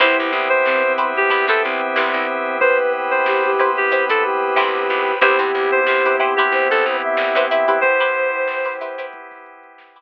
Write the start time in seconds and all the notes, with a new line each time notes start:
0.00 C2 B3 C4 E4 G4 B4 C5 E5 G5, kick, closed hi-hat
0.18 C2, snare, closed hi-hat
0.32 C2, closed hi-hat
0.49 C5, closed hi-hat
0.65 G2 C4, snare
0.83 C4, closed hi-hat
0.98 E4 G4 B4 C5, closed hi-hat
1.15 G4, snare, closed hi-hat
1.30 C2 E4 G4 B4 C5, kick, closed hi-hat
1.48 C3 E4 G4 A4 B4 C5, kick, closed hi-hat
1.62 C2 C4, closed hi-hat
1.81 closed hi-hat
1.96 C2 E4 G4 B4 C5, snare
2.14 C2, closed hi-hat
2.29 closed hi-hat
2.46 closed hi-hat
2.60 B4 C5 G5 B5, kick, closed hi-hat
2.79 closed hi-hat
2.93 closed hi-hat
3.11 C5, snare, closed hi-hat
3.26 G4, snare
3.44 G4, closed hi-hat
3.58 E4 G4 B4 C5, snare, closed hi-hat
3.77 G4, closed hi-hat
3.91 E4 G4 B4 C5, kick, closed hi-hat
4.09 E4 G4 A4 B4 C5, kick, closed hi-hat
4.23 G4, closed hi-hat
4.56 D2 E4 G4 B4 C5, snare
4.75 closed hi-hat
4.89 C#2, closed hi-hat
5.07 snare, closed hi-hat
5.21 C2 B3 C4 E4 G4 B4 C5, kick, closed hi-hat
5.39 G2 E4 G4 B4 C5, closed hi-hat
5.54 C2, closed hi-hat
5.72 C5, closed hi-hat
5.85 C3 G4, snare
6.04 E4 G4 B4 C5, closed hi-hat
6.20 E4 G4 B4 C5, closed hi-hat
6.36 E4 G4 B4 C5, snare, closed hi-hat
6.52 C2 C5, kick
6.70 C2 A4, kick, closed hi-hat
6.84 C2, closed hi-hat
7.02 E5, closed hi-hat
7.17 C2, snare
7.35 G2 E4 G4 B4 C5, closed hi-hat
7.50 E4 G4 B4 C5 E5, snare, closed hi-hat
7.68 E4 G4 B4 C5, kick, open hi-hat
7.81 B3 C4 G4 B4 C5, kick, closed hi-hat
8.00 E4 G4 B4 C5, closed hi-hat
8.15 snare, closed hi-hat
8.34 closed hi-hat
8.48 snare
8.65 E4 G4 B4 C5, snare, closed hi-hat
8.81 E4 G4 B4 C5, closed hi-hat
8.98 E4 G4 B4 C5, snare, closed hi-hat
9.13 kick, closed hi-hat
9.31 kick, snare, closed hi-hat
9.46 closed hi-hat
9.63 closed hi-hat
9.78 snare
9.96 E4 G4 B4 C5, closed hi-hat